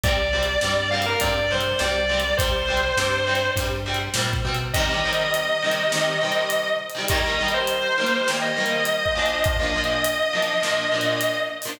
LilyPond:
<<
  \new Staff \with { instrumentName = "Distortion Guitar" } { \time 4/4 \key g \minor \tempo 4 = 102 d''4. f''16 bes'16 d''8 c''8 d''4 | c''2 r2 | \key c \minor ees''1 | ees''8. c''4~ c''16 r16 ees''4.~ ees''16 |
ees''1 | }
  \new Staff \with { instrumentName = "Overdriven Guitar" } { \time 4/4 \key g \minor <c g>8 <c g>8 <c g>8 <c g>8 <c g>8 <c g>8 <c g>8 <c g>8 | <c g>8 <c g>8 <c g>8 <c g>8 <c g>8 <c g>8 <c g>8 <c g>8 | \key c \minor <c ees g>16 <c ees g>16 <c ees g>4 <c ees g>8 <c ees g>8 <c ees g>4~ <c ees g>16 <c ees g>16 | <ees g bes>16 <ees g bes>16 <ees g bes>4 <ees g bes>8 <ees g bes>8 <ees g bes>4 <bes, f d'>8~ |
<bes, f d'>16 <bes, f d'>16 <bes, f d'>4 <bes, f d'>8 <bes, f d'>8 <bes, f d'>4~ <bes, f d'>16 <bes, f d'>16 | }
  \new Staff \with { instrumentName = "Synth Bass 1" } { \clef bass \time 4/4 \key g \minor c,4 g,4 g,4 c,4 | c,4 g,4 g,4 bes,8 b,8 | \key c \minor r1 | r1 |
r1 | }
  \new DrumStaff \with { instrumentName = "Drums" } \drummode { \time 4/4 \tuplet 3/2 { <hh bd>8 r8 hh8 sn8 r8 hh8 <hh bd>8 r8 hh8 sn8 r8 hh8 } | \tuplet 3/2 { <hh bd>8 r8 hh8 sn8 r8 hh8 <hh bd>8 r8 hh8 sn8 bd8 hh8 } | \tuplet 3/2 { <hh bd>8 r8 hh8 hh8 r8 hh8 sn8 r8 hh8 hh8 r8 hh8 } | \tuplet 3/2 { <hh bd>8 r8 hh8 hh8 r8 hh8 sn8 r8 hh8 hh8 bd8 hh8 } |
\tuplet 3/2 { <hh bd>8 r8 hh8 hh8 r8 hh8 sn8 r8 hh8 hh8 r8 hho8 } | }
>>